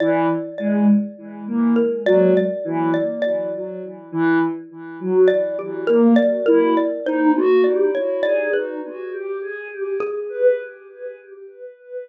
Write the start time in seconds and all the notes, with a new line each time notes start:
0.00 E3 D5
0.58 G#3 D5
1.47 A#3
1.76 A#4
2.06 F#3 D5
2.37 D5
2.64 E3
2.94 D5
3.22 D5
4.12 E3
5.00 F#3
5.28 D5
5.59 G4
5.87 A#3 A#4
6.16 D5
6.46 E4 A#4
6.77 D5
7.06 D#4 C5
7.35 F#4
7.64 G4 D5
7.95 C#5
8.23 G#4 D5
8.53 B4
9.12 G4
9.41 G#4
9.71 G4
10.00 G#4
10.29 B4